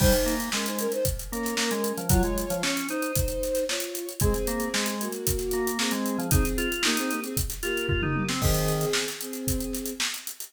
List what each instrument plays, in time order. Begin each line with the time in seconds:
0.00 drawbar organ G3, violin D#4 C5, kick, crash
0.12 snare, closed hi-hat
0.26 drawbar organ A#3, closed hi-hat
0.40 closed hi-hat
0.52 drawbar organ G#3, violin C#4 A#4, snare
0.66 violin D#4 C5, snare, closed hi-hat
0.79 violin C#4 A#4, closed hi-hat
0.92 violin D#4 C5, closed hi-hat
1.05 kick, closed hi-hat
1.19 closed hi-hat
1.31 drawbar organ A#3, violin C#4 A#4, closed hi-hat
1.43 snare, closed hi-hat
1.57 drawbar organ A#3, snare
1.71 drawbar organ G#3, closed hi-hat
1.84 closed hi-hat
1.97 drawbar organ F3, closed hi-hat
2.09 drawbar organ F#3, violin F4 C#5, kick, closed hi-hat
2.23 drawbar organ G#3, closed hi-hat
2.38 closed hi-hat
2.50 drawbar organ F3, closed hi-hat
2.63 drawbar organ C#4, snare
2.76 snare, closed hi-hat
2.89 violin D#4 C5, drawbar organ D#4, closed hi-hat
3.02 closed hi-hat
3.15 kick, closed hi-hat
3.28 closed hi-hat
3.43 snare, closed hi-hat
3.55 snare, closed hi-hat
3.69 violin F4 C#5, snare
3.80 closed hi-hat
3.94 snare, closed hi-hat
4.09 closed hi-hat
4.20 drawbar organ G#3, violin C4 G#4, kick, closed hi-hat
4.34 closed hi-hat
4.47 drawbar organ A#3, closed hi-hat
4.60 closed hi-hat
4.74 drawbar organ G#3, snare
4.86 snare, closed hi-hat
5.00 violin A#3 F#4, closed hi-hat
5.12 closed hi-hat
5.27 kick, closed hi-hat
5.38 snare, closed hi-hat
5.51 drawbar organ A#3, snare, closed hi-hat
5.67 closed hi-hat
5.79 drawbar organ A#3, violin C4 G#4, snare
5.91 drawbar organ G#3, closed hi-hat
6.06 closed hi-hat
6.18 drawbar organ F3, closed hi-hat
6.31 violin C4 G#4, drawbar organ D#4, kick, closed hi-hat
6.45 closed hi-hat
6.58 drawbar organ F4, closed hi-hat
6.72 closed hi-hat
6.83 violin A#3 G4, drawbar organ D#4, snare
6.97 violin C4 G#4, snare, closed hi-hat
7.11 violin A#3 G4, closed hi-hat
7.24 violin C4 G#4, closed hi-hat
7.37 kick, closed hi-hat
7.50 snare, closed hi-hat
7.63 violin A#3 G4, drawbar organ F4, snare, closed hi-hat
7.77 closed hi-hat
7.88 drawbar organ F4, kick, floor tom
8.02 drawbar organ D#4, mid tom
8.16 high tom
8.29 drawbar organ C4, snare
8.42 drawbar organ D#3, violin C4 G#4, kick, crash
8.54 closed hi-hat
8.68 closed hi-hat
8.81 snare, closed hi-hat
8.93 snare
9.08 snare, closed hi-hat
9.21 violin C4 G#4, closed hi-hat
9.33 closed hi-hat
9.47 kick, closed hi-hat
9.60 closed hi-hat
9.73 snare, closed hi-hat
9.86 closed hi-hat
10.00 snare
10.14 closed hi-hat
10.27 closed hi-hat
10.40 closed hi-hat